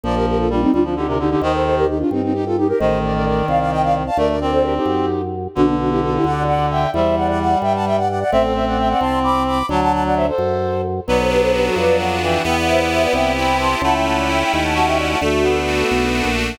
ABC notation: X:1
M:6/8
L:1/16
Q:3/8=87
K:Gm
V:1 name="Flute"
[Bd] [GB] [GB] [FA] [DF] [CE] [DF] [DF] [EG] [GB] [EG] [EG] | [ce] [Ac] [Ac] [GB] [EG] [DF] [CE] [CE] [EG] [FA] [EG] [GB] | [ce]2 [Bd] [Bd] [Bd]2 [df] [df] [eg] [df] z [fa] | [Bd] [Bd] [Bd] [Ac] [GB] [EG]5 z2 |
[K:G] [DF] [B,D] [DF] [EG] [FA] [EG] [df]2 [df]2 [eg]2 | [ce]2 [df] [df] [df]2 [eg] [fa] [eg] [df] [df] [df] | [ce] [Ac] [ce] [df] [eg] [df] [ac']2 [bd']2 [bd']2 | [fa] [fa] [fa] [df] [ce] [Ac]5 z2 |
[Bd] [Ac] [GB] [Ac] [GB] [FA] [Bd]2 [df]2 [eg]2 | [eg] [df] [ce] [df] [ce] [Bd] [eg]2 [gb]2 [ac']2 | [fa] [eg] [fa] [df] [eg] [eg] [gb] [fa] [fa] [eg] [df] [fa] | [FA]8 z4 |]
V:2 name="Clarinet"
F,4 G,2 G, F, D, C, D, D, | E,4 z8 | E,12 | A,2 C6 z4 |
[K:G] D,12 | G,10 z2 | C12 | F,6 z6 |
F,10 E,2 | B,8 C4 | E8 F4 | A,2 B,8 z2 |]
V:3 name="Accordion"
z12 | z12 | z12 | z12 |
[K:G] z12 | z12 | z12 | z12 |
B,2 D2 F2 B,2 D2 F2 | B,2 E2 G2 B,2 E2 G2 | A,2 ^C2 E2 A,2 C2 E2 | A,2 D2 F2 A,2 D2 F2 |]
V:4 name="Drawbar Organ" clef=bass
B,,,6 D,,6 | E,,6 G,,6 | A,,,6 C,,6 | D,,6 ^F,,6 |
[K:G] B,,,6 D,,6 | E,,6 G,,6 | A,,,6 C,,6 | D,,6 F,,6 |
B,,,6 =F,,6 | E,,6 C,,6 | ^C,,6 ^D,,6 | D,,6 B,,,3 ^A,,,3 |]